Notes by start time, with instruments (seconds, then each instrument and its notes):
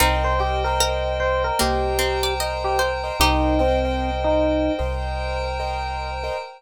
0.00 synth bass 2 C2, pizzicato strings C4 D#4, acoustic grand piano A#4 C5 D#5 G5, pad 5 (bowed) A#4 C5 D#5 G5, electric piano 1 A#4
0.24 electric piano 1 C5
0.39 electric piano 1 G4, acoustic grand piano A#4 C5 D#5 G5
0.64 electric piano 1 A#4, acoustic grand piano A#4 C5 D#5 G5
0.80 pizzicato strings A#4
1.20 electric piano 1 C5
1.44 electric piano 1 A#4
1.59 synth bass 2 C2, pizzicato strings A#3, electric piano 1 G4, pad 5 (bowed) A#4 C5 G5 A#5, acoustic grand piano A#4 C5 D#5 G5
1.99 pizzicato strings C4
2.23 pizzicato strings D5
2.40 acoustic grand piano A#4 C5 D#5 G5, pizzicato strings D#5
2.64 electric piano 1 G4
2.79 pizzicato strings C5
3.04 acoustic grand piano A#4 C5 D#5 G5
3.20 synth bass 2 C2, electric piano 1 D#4, pizzicato strings D#4 G4, pad 5 (bowed) A#4 C5 D#5 G5, acoustic grand piano A#4 C5 D#5 G5
3.59 electric piano 1 C4, acoustic grand piano A#4 C5 D#5 G5
3.85 acoustic grand piano A#4 C5 D#5 G5
4.24 electric piano 1 D#4
4.79 synth bass 2 C2, acoustic grand piano A#4 C5 D#5 G5, pad 5 (bowed) A#4 C5 G5 A#5
5.60 acoustic grand piano A#4 C5 D#5 G5
6.24 acoustic grand piano A#4 C5 D#5 G5